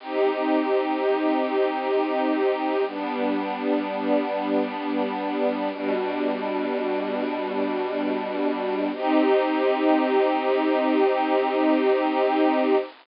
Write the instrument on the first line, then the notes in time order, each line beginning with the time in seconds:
string ensemble 1
0.00 C4 D#4 G4
2.86 G3 B3 D4
5.71 B2 G3 D4
8.93 C4 D#4 G4